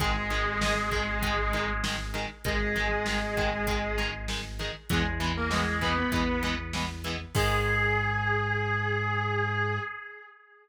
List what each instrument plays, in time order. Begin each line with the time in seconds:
0.00 synth bass 1 G#1, overdriven guitar D#3 G#3, distortion guitar G#3 G#4, kick, closed hi-hat
0.30 overdriven guitar D#3 G#3, closed hi-hat
0.61 overdriven guitar D#3 G#3, snare
0.91 overdriven guitar D#3 G#3, kick, closed hi-hat
1.22 overdriven guitar D#3 G#3, kick, closed hi-hat
1.53 overdriven guitar D#3 G#3, closed hi-hat
1.84 overdriven guitar D#3 G#3, snare
2.14 overdriven guitar D#3 G#3, closed hi-hat
2.44 synth bass 1 G#1, overdriven guitar D#3 G#3, distortion guitar G#3 G#4, kick, closed hi-hat
2.76 overdriven guitar D#3 G#3, closed hi-hat
3.06 overdriven guitar D#3 G#3, snare
3.37 overdriven guitar D#3 G#3, kick, closed hi-hat
3.67 overdriven guitar D#3 G#3, kick, closed hi-hat
3.98 overdriven guitar D#3 G#3, closed hi-hat
4.28 overdriven guitar D#3 G#3, snare
4.59 overdriven guitar D#3 G#3, closed hi-hat
4.89 synth bass 1 E2, overdriven guitar E3 G#3 B3, distortion guitar G#3 G#4, kick, closed hi-hat
5.20 overdriven guitar E3 G#3 B3, closed hi-hat
5.37 distortion guitar A#3 A#4
5.50 overdriven guitar E3 G#3 B3, distortion guitar G#3 G#4, snare
5.81 overdriven guitar E3 G#3 B3, distortion guitar B3 B4, kick, closed hi-hat
5.98 distortion guitar B3 B4
6.12 synth bass 1 E2, overdriven guitar E3 G#3 B3, kick, closed hi-hat
6.43 overdriven guitar E3 G#3 B3, closed hi-hat
6.73 overdriven guitar E3 G#3 B3, snare
7.04 overdriven guitar E3 G#3 B3, closed hi-hat
7.35 synth bass 1 G#2, overdriven guitar D#3 G#3, distortion guitar G#4, kick, crash